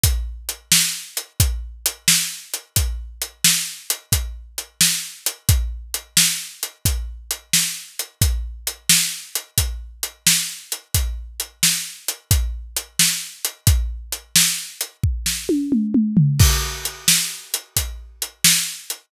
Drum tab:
CC |------------|------------|------------|------------|
HH |x-x--xx-x--x|x-x--xx-x--x|x-x--xx-x--x|x-x--xx-x--x|
SD |---o-----o--|---o-----o--|---o-----o--|---o-----o--|
T1 |------------|------------|------------|------------|
T2 |------------|------------|------------|------------|
FT |------------|------------|------------|------------|
BD |o-----o-----|o-----o-----|o-----o-----|o-----o-----|

CC |------------|------------|x-----------|
HH |x-x--xx-x--x|x-x--x------|--x--xx-x--x|
SD |---o-----o--|---o---o----|---o-----o--|
T1 |------------|--------o---|------------|
T2 |------------|---------oo-|------------|
FT |------------|-----------o|------------|
BD |o-----o-----|o-----o-----|o-----o-----|